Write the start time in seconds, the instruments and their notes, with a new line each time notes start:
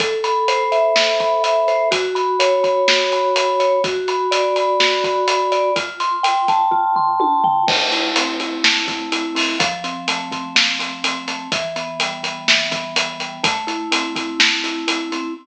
0.00 vibraphone A4, kick, closed hi-hat
0.24 vibraphone B5, closed hi-hat
0.48 vibraphone C5, closed hi-hat
0.72 vibraphone E5, closed hi-hat
0.96 vibraphone A4, snare
1.20 vibraphone B5, kick, closed hi-hat
1.44 vibraphone E5, closed hi-hat
1.68 vibraphone C5, closed hi-hat
1.91 vibraphone F#4, kick, closed hi-hat
2.15 vibraphone B5, closed hi-hat
2.40 vibraphone C#5, closed hi-hat
2.64 vibraphone B5, kick, closed hi-hat
2.88 vibraphone F#4, snare
3.12 vibraphone B5, closed hi-hat
3.36 vibraphone B5, closed hi-hat
3.60 vibraphone C#5, closed hi-hat
3.84 vibraphone F#4, kick, closed hi-hat
4.08 vibraphone B5, closed hi-hat
4.31 vibraphone D5, closed hi-hat
4.56 vibraphone B5, closed hi-hat
4.80 vibraphone F#4, snare
5.04 vibraphone B5, kick, closed hi-hat
5.28 vibraphone B5, closed hi-hat
5.52 vibraphone D5, closed hi-hat
5.76 vibraphone F4, kick, closed hi-hat
6.00 vibraphone C6, closed hi-hat
6.23 vibraphone G5, closed hi-hat
6.48 vibraphone A5, kick, closed hi-hat
6.71 vibraphone F4, kick
6.96 vibraphone C6, floor tom
7.20 vibraphone A5, high tom
7.44 vibraphone G5, floor tom
7.67 vibraphone A3, kick, crash
7.92 vibraphone E4, closed hi-hat
8.16 vibraphone C4, closed hi-hat
8.40 vibraphone E4, closed hi-hat
8.64 vibraphone A3, snare
8.88 vibraphone E4, kick, closed hi-hat
9.12 vibraphone E4, closed hi-hat
9.35 vibraphone C4, open hi-hat
9.59 vibraphone F3, kick, closed hi-hat
9.84 vibraphone C4, closed hi-hat
10.08 vibraphone A3, closed hi-hat
10.32 vibraphone C4, kick, closed hi-hat
10.55 vibraphone F3, snare
10.79 vibraphone C4, closed hi-hat
11.04 vibraphone C4, closed hi-hat
11.28 vibraphone A3, closed hi-hat
11.52 vibraphone E3, kick, closed hi-hat
11.76 vibraphone B3, closed hi-hat
12.00 vibraphone G3, closed hi-hat
12.23 vibraphone B3, closed hi-hat
12.48 vibraphone E3, snare
12.71 vibraphone B3, kick, closed hi-hat
12.96 vibraphone B3, closed hi-hat
13.20 vibraphone G3, closed hi-hat
13.43 vibraphone A3, kick, closed hi-hat
13.67 vibraphone E4, closed hi-hat
13.92 vibraphone C4, closed hi-hat
14.15 vibraphone E4, kick, closed hi-hat
14.40 vibraphone A3, snare
14.64 vibraphone E4, closed hi-hat
14.88 vibraphone E4, closed hi-hat
15.12 vibraphone C4, closed hi-hat